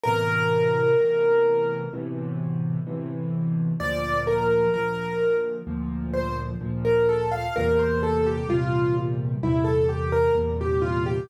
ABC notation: X:1
M:4/4
L:1/16
Q:1/4=64
K:F
V:1 name="Acoustic Grand Piano"
B8 z8 | d2 B2 B3 z3 c z2 B A f | B c A G F2 z2 E A G B z G F G |]
V:2 name="Acoustic Grand Piano" clef=bass
[A,,=B,,C,E,]4 [A,,B,,C,E,]4 [A,,B,,C,E,]4 [A,,B,,C,E,]4 | [D,,B,,F,]4 [D,,B,,F,]4 [D,,B,,F,]4 [D,,B,,F,]4 | [E,,B,,C,G,]4 [E,,B,,C,G,]4 [E,,B,,C,G,]4 [E,,B,,C,G,]4 |]